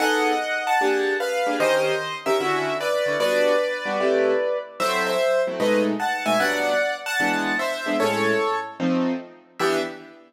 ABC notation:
X:1
M:4/4
L:1/8
Q:"Swing" 1/4=150
K:Em
V:1 name="Acoustic Grand Piano"
[^df]3 [fa]3 [B^e]2 | [c_e]3 =e3 [Bd]2 | [Bd]8 | [ce] [ce]2 z [B^d] z [fa] [e^g] |
[df]3 [fa]3 [ce]2 | [A^c]3 z5 | e2 z6 |]
V:2 name="Acoustic Grand Piano"
[B,^D^GA]4 [^A,=D=G^G]3 [A,D=G^G] | [_E,_DG_B]3 [E,DGB] [=D,^C=EF]3 [D,CEF] | [G,B,DF]3 [G,B,DF] [C,A,EG]4 | [F,A,CE]3 [F,A,CE] [B,,^G,A,^D]3 [B,,G,A,D] |
[G,,F,B,D]4 [E,^G,B,D]3 [E,G,B,D] | [A,,^G,^CE]4 [=F,A,=C_E]4 | [E,B,DG]2 z6 |]